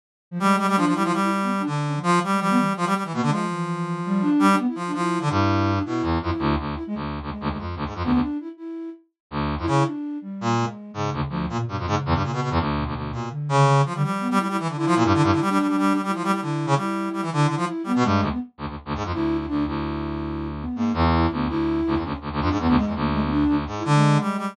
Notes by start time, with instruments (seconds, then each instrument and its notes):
0.31 flute F3
0.40 brass section G3, flute G#3
0.58 brass section G3
0.68 brass section G3
0.76 brass section F3, flute D4
0.86 brass section F3
0.93 brass section G3, flute E4
1.04 brass section F3
1.13 brass section G3
1.22 flute E4
1.31 flute E4
1.42 flute B3
1.59 flute D4
1.66 brass section D3
1.86 flute C#4
1.95 flute F3
2.03 brass section F3
2.24 brass section G3
2.31 flute G#3
2.40 flute F3, brass section G3
2.49 flute B3
2.58 flute E3
2.77 brass section F3
2.86 brass section G3
2.95 brass section G3
3.04 brass section E3
3.13 brass section B2, flute A#3
3.22 brass section D3
3.28 brass section F3, flute G#3
3.50 flute E3
4.06 flute G3
4.21 flute D4
4.39 brass section G3
4.49 flute D4
4.58 flute B3
4.67 flute E4
4.75 brass section F3
4.87 flute D4
4.94 brass section F3, flute E4
5.21 brass section D3, flute D4
5.30 brass section G2, flute E4
5.75 flute D4
5.85 brass section B2, flute E4
6.02 brass section E2
6.21 brass section F2, flute E4
6.39 brass section D2
6.59 brass section D2
6.75 flute E4
6.87 flute G#3
6.95 brass section D2
7.22 brass section D2
7.30 flute G#3
7.41 brass section D2
7.50 brass section D2
7.59 brass section F2
7.76 brass section D2
7.86 brass section G#2
7.95 brass section F2
8.03 brass section D2, flute B3
8.13 brass section D2
8.21 flute D4
8.40 flute E4
8.57 flute E4
9.31 brass section D2
9.58 brass section F2, flute E4
9.67 brass section C#3, flute E4
9.85 flute D4
10.22 flute G3
10.41 brass section A#2
10.59 flute G#3
10.94 brass section G#2, flute C#3
11.13 brass section D2
11.29 brass section D2, flute F3
11.49 flute A#2, brass section A#2
11.67 brass section G2, flute B2
11.78 brass section F2
11.86 brass section G#2, flute C#3
12.05 brass section E2
12.14 brass section G2
12.23 brass section A#2
12.32 brass section B2
12.42 brass section B2
12.51 brass section E2
12.59 brass section D2
12.76 flute B2
12.86 brass section D2
12.95 brass section D2
13.10 brass section A#2, flute B2
13.31 flute D3
13.49 brass section C#3
13.76 flute C#3
13.85 brass section F3
13.94 flute D3, brass section G3
14.03 flute F3, brass section G3
14.19 flute B3
14.31 brass section G3
14.37 brass section G3, flute E4
14.49 brass section G3, flute E4
14.60 brass section E3
14.69 brass section D3
14.76 brass section D3, flute E4
14.87 brass section F3
14.96 brass section A#2
15.05 brass section G2
15.14 brass section D3
15.23 brass section G2
15.32 brass section D3
15.41 brass section G3
15.48 brass section G3, flute D4
15.59 brass section G3
15.68 brass section G3
15.78 brass section G3
15.93 brass section G3
16.03 brass section G3, flute E4
16.15 brass section F3
16.24 brass section G3
16.33 brass section G3
16.40 brass section D3, flute E4
16.66 brass section C#3
16.76 brass section G3, flute E4
17.13 brass section G3
17.22 brass section E3
17.30 brass section D3, flute E4
17.47 brass section D3
17.57 brass section F3
17.66 flute E4
17.84 brass section G3, flute B3
17.96 brass section B2
18.03 brass section G2, flute G#3
18.21 brass section D2
18.31 flute B3
18.58 brass section D2
18.68 brass section D2
18.85 brass section D2
18.95 brass section G#2
19.04 brass section F2
19.13 brass section D2, flute E4
19.37 flute E4
19.47 brass section D2, flute D4
19.66 brass section D2, flute E4
20.60 flute B3
20.76 brass section G#2, flute A#3
20.94 brass section E2, flute E4
21.15 flute E4
21.30 brass section D2, flute B3
21.48 brass section D2, flute E4
21.87 brass section D2
21.96 brass section E2
22.01 brass section D2, flute C#4
22.21 brass section D2
22.32 brass section D2
22.40 brass section F2, flute D4
22.50 brass section G#2
22.59 brass section E2, flute B3
22.68 brass section D2
22.76 brass section G#2, flute G#3
22.86 brass section E2
22.95 brass section D2, flute A#3
23.13 flute G#3
23.22 flute B3
23.31 flute D4
23.48 brass section D2
23.57 flute D4
23.67 brass section G#2
23.77 flute E4
23.85 brass section D3, flute G#3
23.95 flute G#3
24.20 brass section G3, flute G#3
24.38 brass section G3